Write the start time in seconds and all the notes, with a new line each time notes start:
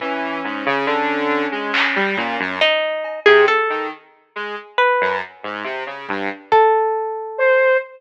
0.00 E3 C#4, kick
0.44 G#2
0.66 C#3
0.86 D3
1.52 G#3
1.74 clap
1.96 G3
2.16 A#2 C#4, kick
2.39 F#2
2.61 D#4
3.04 cowbell
3.26 C3 G#4
3.48 A4
3.70 D#3
4.36 G#3
4.78 B4
5.01 F#2
5.43 G#2
5.64 C3
5.86 C#3
6.09 G2, kick
6.52 A4, kick
7.38 C5